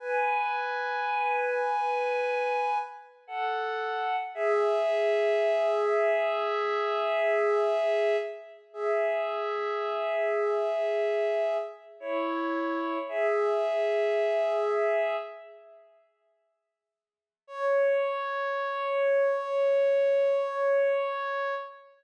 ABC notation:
X:1
M:4/4
L:1/8
Q:1/4=55
K:C#phr
V:1 name="Pad 5 (bowed)"
[Bg]6 [Af]2 | [Ge]8 | [Ge]6 [Ec]2 | [Ge]4 z4 |
c8 |]